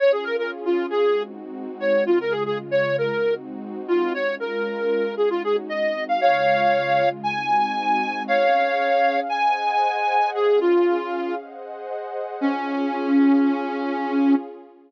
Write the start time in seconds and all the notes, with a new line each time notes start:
0.00 C#4 F4 G#4 C#5
0.12 G#4
0.24 A#4
0.39 A#4
0.65 F4
0.90 G#4
1.03 G#3 C4 D#4 F#4
1.80 C#5
2.06 C#3 G#3 F4
2.21 A#4
2.31 G#4
2.46 G#4
2.71 C#5
2.98 A#4
3.10 G#3 C4 D#4 F#4
3.88 F4
4.14 G#3 C#4 F4 C#5
4.40 A#4
5.17 G#3 C#4 D#4 F#4 G#4
5.30 F4
5.44 G#4
5.69 G#3 C4 D#4 F#4 D#5
6.09 F5
6.21 C#3 G#3 F4 C#5 F5
7.23 G#3 C4 D#4 F#4 G#5
8.28 C#4 G#4 C#5 F5
9.29 G#4 C5 D#5 F#5 G#5
10.34 C#4 G#4 F5
10.61 F4
11.38 G#4 C5 D#5 F#5
12.41 C#4 F4 G#4